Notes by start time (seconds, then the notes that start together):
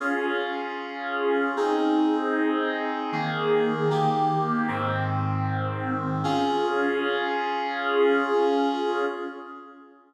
0.00 C#4 F4 G#4
1.56 C4 D#4 G#4
3.12 D#3 A#3 G#4
3.90 D#3 A#3 G4
4.68 G#2 D#3 C4
6.24 C#4 F4 G#4